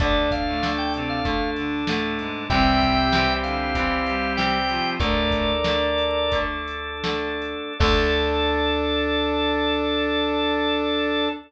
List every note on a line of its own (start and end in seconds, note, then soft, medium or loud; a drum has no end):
0.00 2.29 D2 medium
0.00 0.27 D3 medium
0.00 0.57 D3 medium
0.00 0.57 A3 medium
0.00 2.44 D4 medium
0.00 2.47 D4 medium
0.00 0.27 D4 medium
0.00 2.44 A4 medium
0.00 2.47 A4 medium
0.00 0.30 D5 loud
0.00 kick loud
0.00 closed hi-hat loud
0.31 0.72 F5 loud
0.31 kick medium
0.31 closed hi-hat medium
0.47 0.62 A2 medium
0.47 0.62 A3 medium
0.62 1.19 D3 medium
0.62 1.19 A3 medium
0.62 snare medium
0.78 0.93 G5 loud
0.94 1.20 C3 medium
0.94 1.20 C4 medium
0.94 closed hi-hat medium
1.10 1.50 F5 loud
1.25 1.81 D3 medium
1.25 1.81 A3 medium
1.25 kick medium
1.25 closed hi-hat medium
1.56 1.85 D3 medium
1.56 1.85 D4 medium
1.56 closed hi-hat medium
1.87 2.18 A2 medium
1.87 2.45 D3 medium
1.87 2.18 A3 medium
1.87 2.45 A3 medium
1.87 snare loud
2.19 2.47 G#2 medium
2.19 2.47 G#3 medium
2.19 closed hi-hat medium
2.50 4.80 C2 medium
2.50 3.26 C3 medium
2.50 3.06 C3 medium
2.50 3.06 E3 medium
2.50 3.06 G3 medium
2.50 4.95 C4 medium
2.50 4.97 C4 medium
2.50 3.26 C4 medium
2.50 4.95 E4 medium
2.50 4.97 E4 medium
2.50 4.95 G4 medium
2.50 4.97 G4 medium
2.50 3.34 E5 loud
2.50 3.34 G5 loud
2.50 kick loud
2.50 closed hi-hat medium
2.81 kick medium
2.81 closed hi-hat medium
3.12 3.69 C3 medium
3.12 3.69 E3 medium
3.12 3.69 G3 medium
3.12 snare loud
3.43 3.73 D3 medium
3.43 3.73 D4 medium
3.43 4.33 F5 medium
3.43 closed hi-hat medium
3.75 4.31 C3 medium
3.75 4.01 E3 medium
3.75 4.31 E3 medium
3.75 4.31 G3 medium
3.75 4.01 E4 medium
3.75 kick medium
3.75 closed hi-hat loud
4.06 4.57 G3 medium
4.06 4.57 G4 medium
4.06 closed hi-hat medium
4.37 4.93 C3 medium
4.37 4.93 E3 medium
4.37 4.93 G3 medium
4.37 4.90 G5 loud
4.37 snare medium
4.68 4.98 F3 medium
4.68 4.98 F4 medium
4.68 closed hi-hat medium
4.99 7.55 D2 medium
4.99 5.52 A2 medium
4.99 5.57 D3 medium
4.99 5.57 A3 medium
4.99 5.52 A3 medium
4.99 7.73 D4 medium
4.99 7.77 D4 medium
4.99 7.73 A4 medium
4.99 7.77 A4 medium
4.99 6.39 A#4 loud
4.99 6.39 D5 loud
4.99 kick medium
4.99 closed hi-hat medium
5.31 kick medium
5.31 closed hi-hat medium
5.64 6.25 D3 medium
5.64 6.25 A3 medium
5.64 snare loud
5.98 closed hi-hat medium
6.32 6.97 D3 medium
6.32 6.97 A3 medium
6.32 kick medium
6.32 closed hi-hat medium
6.68 closed hi-hat medium
7.04 7.72 D3 medium
7.04 7.72 A3 medium
7.04 snare loud
7.42 closed hi-hat medium
7.79 11.28 D2 loud
7.79 11.29 D3 loud
7.79 11.29 A3 loud
7.79 11.28 D4 medium
7.79 11.29 D4 loud
7.79 11.28 A4 loud
7.79 11.29 A4 loud
7.79 11.28 D5 loud
7.79 kick loud
7.79 crash loud